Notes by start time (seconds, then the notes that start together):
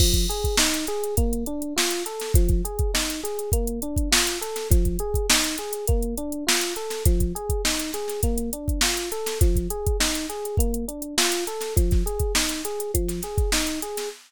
0.00 F3, kick, crash
0.13 kick, closed hi-hat
0.29 G#4, closed hi-hat
0.44 kick, closed hi-hat
0.57 D#4, snare
0.74 snare, closed hi-hat
0.87 G#4, closed hi-hat
1.04 closed hi-hat
1.17 A#3, kick, closed hi-hat
1.33 closed hi-hat
1.46 D4, closed hi-hat
1.62 closed hi-hat
1.76 F4, snare
1.91 closed hi-hat
2.06 A4, closed hi-hat
2.20 snare, closed hi-hat
2.34 F3, kick, closed hi-hat
2.49 kick, closed hi-hat
2.65 G#4, closed hi-hat
2.79 kick, closed hi-hat
2.94 D#4, snare
3.10 closed hi-hat
3.24 G#4, closed hi-hat
3.39 closed hi-hat
3.52 A#3, kick, closed hi-hat
3.67 closed hi-hat
3.82 D4, closed hi-hat
3.96 kick, closed hi-hat
4.12 F4, snare
4.27 closed hi-hat
4.41 A4, closed hi-hat
4.56 snare, closed hi-hat
4.70 F3, kick, closed hi-hat
4.85 kick, closed hi-hat
4.99 G#4, closed hi-hat
5.14 kick, closed hi-hat
5.30 D#4, snare
5.44 closed hi-hat
5.58 G#4, closed hi-hat
5.73 closed hi-hat
5.87 A#3, kick, closed hi-hat
6.02 closed hi-hat
6.18 D4, closed hi-hat
6.32 closed hi-hat
6.47 F4, snare
6.61 closed hi-hat
6.76 A4, closed hi-hat
6.90 snare, closed hi-hat
7.05 F3, kick, closed hi-hat
7.20 kick, closed hi-hat
7.35 G#4, closed hi-hat
7.50 kick, closed hi-hat
7.65 D#4, snare
7.79 closed hi-hat
7.93 G#4, snare, closed hi-hat
8.08 snare, closed hi-hat
8.23 A#3, kick, closed hi-hat
8.38 closed hi-hat
8.53 D4, closed hi-hat
8.68 kick, closed hi-hat
8.81 F4, snare
8.97 closed hi-hat
9.12 A4, closed hi-hat
9.26 snare, closed hi-hat
9.41 F3, kick, closed hi-hat
9.56 kick, closed hi-hat
9.70 G#4, closed hi-hat
9.87 kick, closed hi-hat
10.00 D#4, snare
10.15 closed hi-hat
10.29 G#4, closed hi-hat
10.45 closed hi-hat
10.57 A#3, kick, closed hi-hat
10.74 closed hi-hat
10.88 D4, closed hi-hat
11.02 closed hi-hat
11.18 F4, snare
11.32 closed hi-hat
11.47 A4, closed hi-hat
11.61 snare, closed hi-hat
11.76 F3, kick, closed hi-hat
11.91 kick, snare, closed hi-hat
12.06 G#4, closed hi-hat
12.19 kick, closed hi-hat
12.35 D#4, snare
12.49 snare, closed hi-hat
12.65 G#4, closed hi-hat
12.80 closed hi-hat
12.94 F3, kick, closed hi-hat
13.08 snare, closed hi-hat
13.22 G#4, snare, closed hi-hat
13.38 kick, closed hi-hat
13.52 D#4, snare
13.67 closed hi-hat
13.82 G#4, closed hi-hat
13.97 snare, closed hi-hat